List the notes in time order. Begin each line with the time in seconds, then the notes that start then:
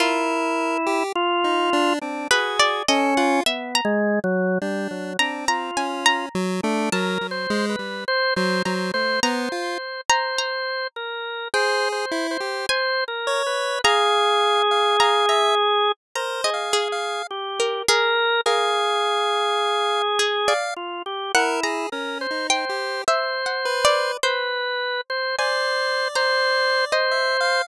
0.00 E4 F4 A#4
0.87 G4
1.15 F4
1.44 D#4
1.73 D4
2.01 C4 D4
2.31 F#4 G#4 B4
2.60 D5
2.88 C#4 A4 D#5
3.17 F4 F#5
3.46 B3 E5
3.75 A#5
3.85 G#3
4.24 F#3
4.62 G3 D4
4.91 F#3
5.19 C4 D4 A#5
5.48 F4 A#5
5.77 C#4 G#5
6.06 A#5
6.35 F#3
6.63 A3 D4
6.92 F#3 A#4 A5
7.21 F#3
7.31 C5
7.50 G#3
7.69 B4
7.79 G3
8.08 C5
8.36 F#3 C5
8.65 F#3 C5 A#5
8.94 A3 C5
9.23 B3 C5 A#5
9.52 F4
10.10 C5 A#5
10.38 A#5
10.96 A#4
11.54 G#4 C5 G5
11.92 C5
12.12 E4
12.31 C5
12.40 G4
12.69 C5 G#5
13.08 A#4
13.27 C#5
13.46 B4
13.84 G#4 F5 A#5
14.71 F5
15.00 F5 A#5
15.29 E5 A#5
16.15 A#4 C5 A#5
16.44 G#4 D#5
16.54 F5
16.73 G#4
16.92 F5
17.31 G4
17.60 A#4
17.88 G#4 A#4
18.46 G#4 A#4 F5
20.19 G#4
20.48 D5 F5
20.76 F4
21.06 G4
21.35 E4 A#4 F#5
21.63 G#4 A#5
21.92 C#4 A#4
22.21 C5
22.31 D#4
22.50 C5 G5
22.69 G4
23.08 C5 E5
23.46 F#5
23.65 B4
23.85 D5
24.23 B4 C5
25.10 C5
25.38 C5 D5 G#5
26.15 C5 A#5
26.92 C5 D#5
27.11 E5
27.41 F5